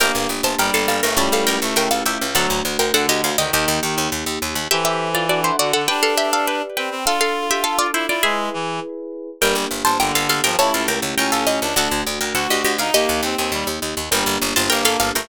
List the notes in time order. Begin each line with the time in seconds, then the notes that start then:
0.00 G1 A#3 D4 G4 A#4 G5
0.15 G1
0.29 G1
0.43 G1 C5 A5
0.59 G1 G3 A#4 G5
0.74 G1 A4 F5
0.88 G1 A4 F5
1.03 G1 A3 A#4 G5
1.17 C#2 G3 A3 C#4 E4 G4 C#5 A5
1.32 C#2 A4 F5
1.47 C#2 A#4 G5
1.62 C#2 A3
1.76 C#2 A#4 G5
1.91 C#2 A4 F5
2.06 C#2 G4 E5
2.21 C#2
2.35 D2 F#3 A3 D4 F#4 A4 F#5
2.50 D2
2.65 D2
2.79 D2 A#4 G5
2.94 D2 D3 A4 F#5
3.09 D2 G4 D#5
3.24 D2 F5
3.38 D2 D#3 G4 D#5
3.53 D#2 D#3 A#3 D#4 G4 D#5
3.68 D#2
3.82 D#2 D#3
3.98 D#2
4.12 D#2
4.26 D#2
4.42 D#2
4.55 D#2
4.71 E3 G4 A4 C5 E5
4.85 G4 E5
5.15 F4 D5
5.29 D4 F#4 A4 D5 F#5
5.44 E4 C5
5.59 D3 F#4 D5
5.73 D3 A4 F#5
5.88 D4 G4 B4 D5 G5
6.03 A4 F5
6.17 G4 E5
6.33 A4 F5
6.47 B4 G5
6.77 C4 B4 G5
6.91 C4
7.05 D4 F4 A4 F5
7.21 A4 F5
7.51 G4 E5
7.64 A4 F5
7.79 F4 D5
7.94 E4 C5
8.08 E4 F4 D5
8.23 G#3 E4 G#4 B4 E5
8.54 E3
9.41 G1 G3 A#3 D4 G4 A#4 G5
9.55 G1
9.71 G1
9.85 G1 C5 A5
10.00 G1 D3 A#4 G5
10.15 G1 A4 F5
10.29 G1 A4 F5
10.44 G1 F3 A#4 G5
10.58 C#2 A3 C#4 E4 G4 C#5 A5
10.74 C#2 A4 F5
10.88 C#2 A#4 G5
11.02 C#2
11.18 C#2 C#4 A#4 G5
11.32 C#2 A4 F5
11.47 C#2 D#5
11.61 C#2 D4
11.76 D2 A3 D4 F#4 A4 F#5
11.91 D2
12.07 D2
12.21 D2 A#4 G5
12.35 D2 F#4 A4 F#5
12.50 D2 G4 D#5
12.65 D2 G4 D#5
12.78 D2 D#4 F5
12.94 D#2 A#3 D#4 G4 D#5
13.09 D#2
13.23 D#2 C4
13.38 D#2 C4
13.52 D#2 G3
13.67 D#2
13.82 D#2
13.97 D#2
14.11 G1 G3 A#3 D4 G4 A#4 G5
14.26 G1
14.42 G1
14.56 G1 C5 A5
14.70 G1 A#3 A#4 G5
14.85 G1 A4 F5
15.00 G1 A4 F5
15.15 G1 A3 A#4 G5